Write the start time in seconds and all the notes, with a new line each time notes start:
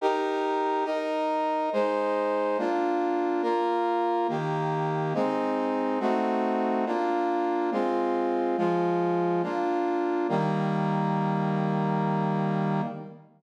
0.01 D#4 G4 A#4
0.85 D#4 A#4 D#5
1.73 G#3 D#4 C5
2.58 A#3 D4 F4
3.43 A#3 F4 A#4
4.29 D#3 A#3 G4
5.14 G#3 C4 D#4
6.00 A3 C4 D#4 F#4
6.86 A#3 D4 F4
7.72 G#3 C4 F4
8.58 F3 G#3 F4
9.43 A#3 D4 F4
10.29 D#3 G3 A#3